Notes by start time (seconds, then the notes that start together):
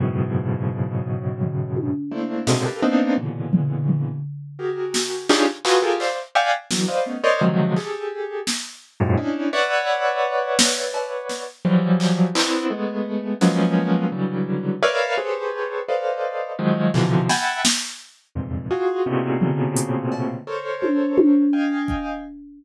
0.00 F#2 G#2 A2 B2 C#3
1.41 floor tom
1.76 high tom
2.11 A3 A#3 C4 D4 E4
2.47 G#2 A2 B2 C3 C#3 D3, snare
2.65 F4 G4 A4 A#4 B4
2.82 A#3 B3 C4 D4 D#4
3.17 A#2 B2 C#3 D3 E3
3.53 floor tom
3.88 floor tom
4.59 F#4 G4 G#4 A#4
4.94 snare
5.29 C#4 D4 D#4 F4 G4 G#4, clap
5.65 F4 F#4 G#4 A4 B4, clap
5.82 F4 G4 G#4 A4 A#4
6.00 C5 D5 E5 F5, clap
6.35 D5 E5 F5 F#5 G5 G#5
6.71 D3 E3 F#3, snare
6.88 B4 C5 D5 D#5 F5
7.06 A3 B3 C#4 D#4
7.24 A#4 C5 C#5 D5 D#5
7.41 C3 D3 D#3 F3 F#3 G#3
7.76 G4 G#4 A4, clap
8.47 snare
9.00 F#2 G#2 A2 A#2
9.17 C#4 D4 D#4 E4
9.53 B4 C#5 D5 E5 F#5
10.59 snare
10.94 cowbell
11.29 snare
11.65 E3 F3 F#3 G3
12.00 clap
12.35 B3 C4 D4 E4, clap
12.70 G#3 A3 B3
13.41 F3 F#3 G#3 A#3 B3 C#4, snare
14.12 C#3 D3 E3 F#3 G3
14.82 A#4 B4 C#5 D5 E5 F5
15.17 G4 G#4 A4 B4 C5 C#5
15.89 A4 B4 C5 D5 D#5 F5
16.59 D#3 F3 F#3 G#3
16.94 B2 C3 D3 E3 F3, clap
17.29 E5 F#5 G5 G#5 A5 B5, snare
17.65 snare
18.35 E2 F2 G2 G#2 A#2 C3
18.71 F4 F#4 G#4
19.06 A2 A#2 B2 C3 C#3
19.41 floor tom
19.76 closed hi-hat
20.12 cowbell
20.47 A4 A#4 C5 C#5
20.82 high tom
21.18 high tom
21.53 D#5 F5 G5 G#5
21.88 kick